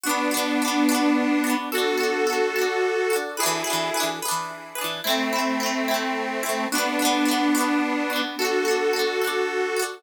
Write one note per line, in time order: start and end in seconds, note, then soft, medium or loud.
0.03 1.55 B3 medium
0.03 1.55 D4 medium
0.03 0.29 D4 loud
0.03 0.29 F#4 loud
0.09 0.29 B3 loud
0.31 0.57 D4 medium
0.31 0.57 F#4 medium
0.37 0.57 B3 loud
0.62 0.87 D4 medium
0.62 0.87 F#4 medium
0.68 0.87 B3 medium
0.89 1.40 D4 medium
0.89 1.40 F#4 medium
0.95 1.40 B3 medium
1.44 1.69 D4 medium
1.44 1.69 F#4 medium
1.50 1.69 B3 medium
1.72 3.16 F#4 medium
1.72 1.98 F#4 loud
1.72 1.97 A4 loud
1.72 3.16 A4 medium
1.78 1.98 D4 medium
1.97 2.23 F#4 medium
1.97 2.23 A4 medium
2.03 2.23 D4 medium
2.27 2.52 F#4 medium
2.27 2.52 A4 medium
2.33 2.52 D4 medium
2.56 3.07 F#4 medium
2.56 3.07 A4 medium
2.62 3.07 D4 medium
3.10 3.36 F#4 loud
3.10 3.36 A4 medium
3.16 3.36 D4 medium
3.37 4.08 E4 medium
3.37 4.08 G#4 medium
3.37 3.63 G#4 loud
3.37 3.63 B4 medium
3.43 3.63 E3 loud
3.43 3.63 D4 loud
3.64 3.90 G#4 medium
3.64 3.90 B4 medium
3.70 3.90 E3 medium
3.70 3.90 D4 medium
3.94 4.20 G#4 medium
3.94 4.20 B4 medium
4.00 4.20 E3 medium
4.00 4.20 D4 medium
4.22 4.73 G#4 medium
4.22 4.73 B4 medium
4.28 4.73 E3 medium
4.28 4.73 D4 loud
4.75 5.01 G#4 medium
4.75 5.01 B4 medium
4.81 5.01 E3 medium
4.81 5.01 D4 medium
5.04 6.67 A3 medium
5.04 6.67 C4 medium
5.04 5.30 C4 loud
5.04 5.30 E4 medium
5.10 5.30 A3 loud
5.33 5.58 C4 medium
5.33 5.58 E4 medium
5.39 5.58 A3 medium
5.60 5.86 C4 medium
5.60 5.86 E4 medium
5.66 5.86 A3 medium
5.88 6.39 C4 medium
5.88 6.39 E4 medium
5.94 6.39 A3 medium
6.43 6.69 C4 medium
6.43 6.69 E4 medium
6.49 6.69 A3 medium
6.72 8.22 B3 medium
6.72 8.22 D4 medium
6.72 6.98 D4 loud
6.72 6.98 F#4 loud
6.78 6.98 B3 loud
6.99 7.25 D4 medium
6.99 7.25 F#4 medium
7.05 7.25 B3 loud
7.25 7.51 D4 medium
7.25 7.51 F#4 medium
7.31 7.51 B3 medium
7.55 8.06 D4 medium
7.55 8.06 F#4 medium
7.61 8.06 B3 medium
8.10 8.35 D4 medium
8.10 8.35 F#4 medium
8.16 8.35 B3 medium
8.38 9.83 F#4 medium
8.38 8.64 F#4 loud
8.38 9.83 A4 medium
8.38 8.64 A4 loud
8.45 8.64 D4 medium
8.65 8.91 F#4 medium
8.65 8.91 A4 medium
8.71 8.91 D4 medium
8.93 9.19 F#4 medium
8.93 9.19 A4 medium
8.99 9.19 D4 medium
9.22 9.73 F#4 medium
9.22 9.73 A4 medium
9.27 9.73 D4 medium
9.77 10.02 F#4 loud
9.77 10.02 A4 medium
9.82 10.02 D4 medium